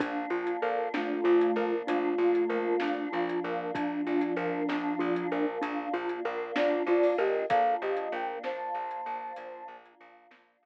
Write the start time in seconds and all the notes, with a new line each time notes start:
0.00 A#1 A#3 D4 F4, kick, closed hi-hat
0.30 A#1 F4
0.47 closed hi-hat
0.61 A#1 A4 A#4 F5
0.94 A#1 A3 D4 F4, snare
1.24 A#1 F4
1.41 closed hi-hat
1.56 A#1 A#4
1.87 A#1 A3 D4 F4, closed hi-hat
2.18 A#1 F4
2.35 closed hi-hat
2.49 A#1 A#4
2.80 A#1 D4, snare
3.12 A#1 F3 D4 F4
3.29 closed hi-hat
3.44 A#1 A#4
3.75 A#1 F3 D4, kick, closed hi-hat
4.07 A#1 F4
4.21 closed hi-hat
4.36 A#1 A#4
4.69 A#1 D4, snare
4.99 A#1 F4
5.16 closed hi-hat
5.32 A#1 A#4
5.61 A#1 D4, closed hi-hat
5.93 A#1 F4
6.09 closed hi-hat
6.25 A#1 A#4
6.56 A#1 D4 F4 D5, snare
6.87 A#1 F4 D5
7.03 open hi-hat
7.18 A#1 G4 A#4 D#5
7.49 A#1 A#3 D4 F4 A4 F5, kick, closed hi-hat
7.82 A#1 G4 D#5
7.97 closed hi-hat
8.12 A#1 A#4 G5
8.43 A#1 C5 A5, snare
8.74 A#1
8.91 closed hi-hat
9.06 A#1
9.36 A#1, closed hi-hat
9.68 A#1
9.86 closed hi-hat
10.01 A#1
10.31 A#1, snare
10.63 A#1